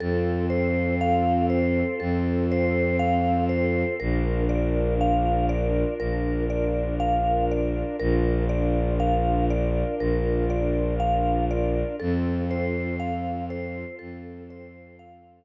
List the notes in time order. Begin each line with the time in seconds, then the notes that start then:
0.00 F2 C4 F4 A4
0.50 C5
1.01 F5
1.50 C5
2.00 F2 A4
2.51 C5
2.99 F5
3.49 C5
4.00 A#1 D4 F4 A#4
4.49 D5
5.01 F5
5.49 D5
5.99 A#1 A#4
6.50 D5
7.00 F5
7.51 D5
8.00 A#1 D4 F4 A#4
8.49 D5
9.00 F5
9.50 D5
10.00 A#1 A#4
10.50 D5
11.00 F5
11.51 D5
12.00 F2 C4 F4 A4
12.51 C5
13.00 F5
13.50 C5
13.99 F2 A4
14.50 C5
14.99 F5